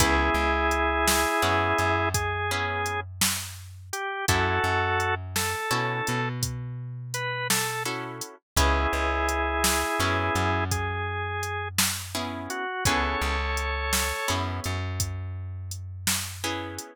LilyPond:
<<
  \new Staff \with { instrumentName = "Drawbar Organ" } { \time 12/8 \key cis \minor \tempo 4. = 56 <e' gis'>2. gis'4. r4 g'8 | <fis' a'>4. a'4. r4 b'8 a'8 r4 | <e' gis'>2. gis'4. r4 fis'8 | <a' cis''>2~ <a' cis''>8 r2. r8 | }
  \new Staff \with { instrumentName = "Acoustic Guitar (steel)" } { \time 12/8 \key cis \minor <b cis' e' gis'>2 <b cis' e' gis'>4. <b cis' e' gis'>2~ <b cis' e' gis'>8 | <cis' e' fis' a'>2 <cis' e' fis' a'>2. <cis' e' fis' a'>4 | <b cis' e' gis'>2 <b cis' e' gis'>2. <b cis' e' gis'>4 | <b cis' e' gis'>2 <b cis' e' gis'>2. <b cis' e' gis'>4 | }
  \new Staff \with { instrumentName = "Electric Bass (finger)" } { \clef bass \time 12/8 \key cis \minor cis,8 cis,4. fis,8 fis,2.~ fis,8 | fis,8 fis,4. b,8 b,2.~ b,8 | cis,8 cis,4. fis,8 fis,2.~ fis,8 | cis,8 cis,4. fis,8 fis,2.~ fis,8 | }
  \new DrumStaff \with { instrumentName = "Drums" } \drummode { \time 12/8 <hh bd>4 hh8 sn4 hh8 <hh bd>4 hh8 sn4 hh8 | <hh bd>4 hh8 sn4 hh8 <hh bd>4 hh8 sn4 hh8 | <hh bd>4 hh8 sn4 hh8 <hh bd>4 hh8 sn4 hh8 | <hh bd>4 hh8 sn4 hh8 <hh bd>4 hh8 sn4 hh8 | }
>>